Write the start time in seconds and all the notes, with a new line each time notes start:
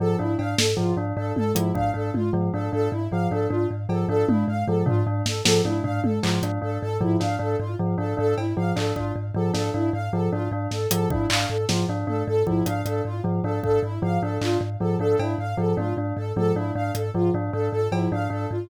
0.00 G#2 F3 A4
0.19 G#2 D4 E4
0.39 G#2 D4 F5, cowbell
0.58 G#2 A4, snare
0.77 G#2 F3 F4, floor tom
0.97 G#2 D4
1.17 G#2 D4 A4
1.36 G#2 A4, high tom
1.55 G#2 F3 E4, closed hi-hat
1.75 G#2 D4 F5, kick
1.94 G#2 D4 A4
2.14 G#2 F4, high tom
2.33 G#2 F3
2.54 G#2 D4 A4
2.73 G#2 D4 A4
2.92 G#2 E4
3.11 G#2 F3 F5
3.31 G#2 D4 A4
3.50 G#2 D4 F4
3.71 G#2
3.89 G#2 F3 A4, cowbell
4.09 G#2 D4 A4
4.28 G#2 D4 E4, high tom
4.48 G#2 F5
4.67 G#2 F3 A4
4.86 G#2 D4 F4, floor tom
5.07 G#2 D4
5.26 G#2 A4, snare
5.45 G#2 F3 A4, snare
5.65 G#2 D4 E4, high tom
5.84 G#2 D4 F5, floor tom
6.04 G#2 A4, high tom
6.23 G#2 F3 F4, clap
6.43 G#2 D4, closed hi-hat
6.62 G#2 D4 A4
6.81 G#2 A4
7.01 G#2 F3 E4, floor tom
7.20 G#2 D4 F5, snare
7.39 G#2 D4 A4
7.60 G#2 F4
7.79 G#2 F3
7.98 G#2 D4 A4
8.17 G#2 D4 A4
8.38 G#2 E4, cowbell
8.57 G#2 F3 F5
8.76 G#2 D4 A4, clap
8.96 G#2 D4 F4, kick
9.16 G#2
9.34 G#2 F3 A4
9.54 G#2 D4 A4, snare
9.74 G#2 D4 E4
9.93 G#2 F5
10.13 G#2 F3 A4
10.32 G#2 D4 F4
10.52 G#2 D4
10.71 G#2 A4, snare
10.91 G#2 F3 A4, closed hi-hat
11.10 G#2 D4 E4, kick
11.30 G#2 D4 F5, clap
11.49 G#2 A4
11.69 G#2 F3 F4, snare
11.89 G#2 D4
12.07 G#2 D4 A4, high tom
12.27 G#2 A4
12.46 G#2 F3 E4, kick
12.66 G#2 D4 F5, closed hi-hat
12.85 G#2 D4 A4, closed hi-hat
13.05 G#2 F4
13.24 G#2 F3
13.44 G#2 D4 A4
13.63 G#2 D4 A4, kick
13.83 G#2 E4
14.02 G#2 F3 F5
14.22 G#2 D4 A4
14.41 G#2 D4 F4, clap
14.61 G#2
14.80 G#2 F3 A4
14.99 G#2 D4 A4
15.19 G#2 D4 E4, cowbell
15.38 G#2 F5
15.57 G#2 F3 A4
15.77 G#2 D4 F4, high tom
15.97 G#2 D4
16.17 G#2 A4
16.36 G#2 F3 A4, high tom
16.56 G#2 D4 E4
16.75 G#2 D4 F5
16.95 G#2 A4, closed hi-hat
17.14 G#2 F3 F4
17.34 G#2 D4
17.53 G#2 D4 A4
17.72 G#2 A4
17.92 G#2 F3 E4, cowbell
18.12 G#2 D4 F5
18.30 G#2 D4 A4
18.51 G#2 F4